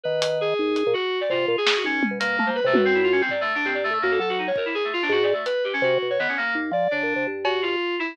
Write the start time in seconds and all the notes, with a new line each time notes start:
0.03 D#3 B4
0.22 closed hi-hat
0.41 G#4
0.59 D#2
0.76 closed hi-hat
0.87 A#2
0.93 F#4
1.21 D5
1.30 C3 F4, floor tom
1.48 A#2 F4
1.58 G#4
1.66 snare
1.76 F#4
1.84 D#2 C#4
2.03 high tom
2.11 B2
2.20 B2 A#3, closed hi-hat
2.39 A3, high tom
2.46 A#3 C5
2.55 B4
2.64 C3 A3
2.73 F#2 B4, high tom
2.85 C4
2.94 E4
3.03 F4
3.12 C#4
3.21 C4
3.29 D5, floor tom
3.41 A3
3.55 D4
3.65 G2 C4
3.74 D5
3.84 A3
3.90 A2 A3
4.02 F#2 A#3
4.11 A4
4.19 F#3 A4
4.29 F#4
4.38 D#4
4.47 C#5
4.56 A#4, kick
4.65 E4
4.74 G#4
4.84 A3
4.93 F4
5.02 D4
5.09 G#2 F#4
5.23 D5
5.33 A3
5.46 B4, closed hi-hat
5.64 G4
5.73 C#4
5.82 C3 F#4
6.02 B2
6.10 C#5
6.19 D#3 B3
6.28 C#4
6.37 A#3
6.55 D#2
6.71 F3 D5
6.91 C#3 D4
7.03 A#2
7.16 C3
7.27 G2
7.44 F#4, cowbell
7.62 F4
7.99 E4